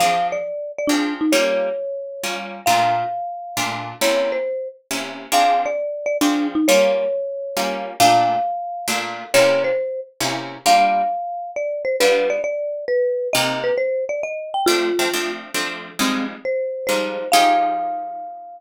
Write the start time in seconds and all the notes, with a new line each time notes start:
0.00 F3 C4 D4 G#4 F5
0.32 D5
0.78 D5
0.87 F3 C4 D4 G#4
1.21 D#4
1.32 G3 A#3 C#4 F4 C#5
2.24 G3 A#3 C#4 F4
2.66 A#2 A3 D4 F4 F5
3.57 A#2 A3 D4 F4
4.01 C3 A#3 C#4 E4 C#5
4.32 C5
4.91 C3 A#3 C#4 E4
5.32 F3 C4 D4 G#4 F5
5.66 D5
6.06 D5
6.21 F3 C4 D4 G#4
6.55 D#4
6.68 G3 A#3 C#4 F4 C#5
7.57 G3 A#3 C#4 F4
8.00 A#2 A3 D4 F4 F5
8.88 A#2 A3 D4 F4
9.34 C3 A#3 C#4 E4 C#5
9.64 C5
10.20 C3 A#3 C#4 E4
10.66 G3 A#3 D4 F4 F5
11.56 D5
11.85 C5
12.00 G3 B3 D4 F4 B4
12.30 D5
12.44 D5
12.88 B4
13.33 C3 A#3 D#4 G4 D#5
13.64 B4
13.78 C5
14.09 D5
14.23 D#5
14.54 G5
14.66 F3 A3 C4 D4 F4
14.99 F3 A3 C4 D4
15.14 F3 A3 C4 D4
15.54 F3 A3 C4 D4
15.99 F3 G3 G#3 C4 D#4
16.45 C5
16.87 F3 G3 G#3 D#4 C5
17.32 F3 D#4 G4 G#4 F5